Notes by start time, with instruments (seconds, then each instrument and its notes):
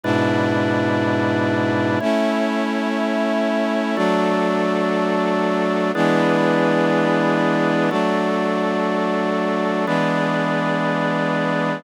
0.03 brass section G#2 B2 D4 E4, drawbar organ G#3 E4 B4 D5
2.00 drawbar organ A3 E4 C#5, brass section A3 C#4 E4
3.97 brass section F#3 A3 D4, drawbar organ F#4 A4 D5
5.95 brass section E3 G#3 B3 D4, drawbar organ E4 G#4 B4 D5
7.91 brass section F#3 A3 D4, drawbar organ F#4 A4 D5
9.86 brass section E3 G#3 B3 D4, drawbar organ E4 G#4 B4 D5